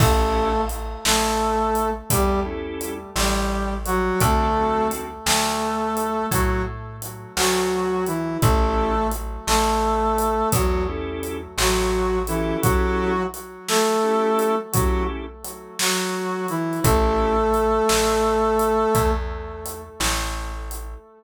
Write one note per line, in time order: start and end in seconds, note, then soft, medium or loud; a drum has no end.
0.00 0.95 A1 loud
0.00 0.61 A3 medium
0.00 0.49 C#4 loud
0.00 0.49 E4 loud
0.00 0.49 G4 loud
0.00 0.49 A4 loud
0.00 0.61 A4 loud
0.00 kick loud
0.00 crash loud
0.69 closed hi-hat medium
1.05 2.00 A1 medium
1.05 1.90 A3 medium
1.05 1.90 A4 medium
1.05 snare loud
1.75 closed hi-hat medium
2.10 3.05 E2 medium
2.10 2.40 G3 medium
2.10 2.40 G4 loud
2.10 kick medium
2.10 closed hi-hat loud
2.45 2.94 C#4 medium
2.45 2.94 E4 loud
2.45 2.94 G4 medium
2.45 2.94 A4 medium
2.81 closed hi-hat medium
3.16 4.10 A1 medium
3.16 3.74 G3 medium
3.16 3.74 G4 medium
3.16 snare loud
3.86 4.20 F#3 medium
3.86 4.20 F#4 loud
3.86 closed hi-hat medium
4.20 5.16 D2 loud
4.20 4.88 A3 loud
4.20 4.46 C4 loud
4.20 4.46 D4 loud
4.20 4.46 F#4 loud
4.20 4.46 A4 loud
4.20 4.88 A4 loud
4.20 kick loud
4.20 closed hi-hat loud
4.56 5.06 C4 medium
4.56 5.06 D4 medium
4.56 5.06 F#4 medium
4.56 5.06 A4 medium
4.91 closed hi-hat medium
5.26 6.21 D2 medium
5.26 6.26 A3 medium
5.26 6.26 A4 medium
5.26 snare loud
5.97 closed hi-hat medium
6.31 7.26 A2 medium
6.31 6.62 F#3 medium
6.31 6.62 F#4 medium
6.31 kick medium
6.31 closed hi-hat loud
7.02 closed hi-hat medium
7.36 8.32 D2 medium
7.36 8.05 F#3 medium
7.36 8.05 F#4 medium
7.36 snare loud
8.06 8.37 E3 medium
8.06 8.37 E4 medium
8.06 closed hi-hat medium
8.42 9.37 A1 loud
8.42 9.07 A3 medium
8.42 8.92 C#4 loud
8.42 8.92 E4 loud
8.42 8.92 G4 loud
8.42 8.92 A4 loud
8.42 9.07 A4 loud
8.42 kick loud
8.42 closed hi-hat medium
9.11 closed hi-hat medium
9.47 10.42 A1 medium
9.47 10.49 A3 medium
9.47 10.49 A4 medium
9.47 snare loud
10.18 closed hi-hat medium
10.52 11.48 E2 medium
10.52 10.83 F#3 medium
10.52 10.83 F#4 medium
10.52 kick medium
10.52 closed hi-hat loud
10.88 11.37 C#4 medium
10.88 11.37 E4 medium
10.88 11.37 G4 medium
10.88 11.37 A4 loud
11.23 closed hi-hat medium
11.58 12.52 A1 loud
11.58 12.19 F#3 medium
11.58 12.19 F#4 medium
11.58 snare loud
12.27 12.57 E3 medium
12.27 13.12 C#4 loud
12.27 12.57 E4 medium
12.27 13.12 E4 loud
12.27 13.12 G4 medium
12.27 13.12 A4 loud
12.27 closed hi-hat medium
12.62 13.23 F#3 loud
12.62 13.23 F#4 loud
12.62 kick loud
12.62 closed hi-hat loud
13.34 closed hi-hat medium
13.68 14.55 A3 medium
13.68 14.55 A4 loud
13.68 snare loud
14.03 14.52 C#4 medium
14.03 14.52 E4 medium
14.03 14.52 G4 medium
14.03 14.52 A4 medium
14.39 closed hi-hat medium
14.72 15.03 F#3 medium
14.72 15.23 C#4 medium
14.72 15.23 E4 medium
14.72 15.03 F#4 medium
14.72 15.23 G4 medium
14.72 15.23 A4 medium
14.72 kick loud
14.72 closed hi-hat loud
15.44 closed hi-hat medium
15.79 16.47 F#3 medium
15.79 16.47 F#4 medium
15.79 snare loud
16.48 16.80 E3 medium
16.48 16.80 E4 medium
16.48 closed hi-hat medium
16.73 closed hi-hat soft
16.84 17.79 A1 loud
16.84 19.11 A3 loud
16.84 17.33 C#4 loud
16.84 17.33 E4 loud
16.84 17.33 G4 loud
16.84 19.11 A4 loud
16.84 17.33 A4 loud
16.84 kick loud
16.84 closed hi-hat loud
17.54 closed hi-hat medium
17.89 18.84 A1 medium
17.89 snare loud
18.59 closed hi-hat medium
18.95 19.90 E2 loud
18.95 kick loud
18.95 closed hi-hat loud
19.66 closed hi-hat medium
20.00 20.95 A1 medium
20.00 snare loud
20.71 closed hi-hat medium